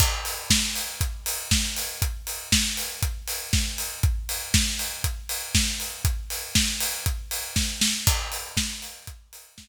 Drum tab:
CC |x-------|--------|--------|--------|
HH |-o-oxo-o|xo-oxo-o|xo-oxo-o|xo-oxo--|
SD |--o---o-|--o---o-|--o---o-|--o---oo|
BD |o-o-o-o-|o-o-o-o-|o-o-o-o-|o-o-o-o-|

CC |x-------|
HH |-o-oxo--|
SD |--o---o-|
BD |o-o-o-o-|